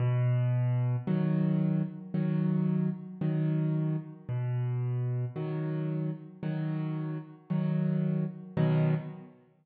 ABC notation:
X:1
M:4/4
L:1/8
Q:1/4=56
K:B
V:1 name="Acoustic Grand Piano" clef=bass
B,,2 [D,F,]2 [D,F,]2 [D,F,]2 | B,,2 [D,F,]2 [D,F,]2 [D,F,]2 | [B,,D,F,]2 z6 |]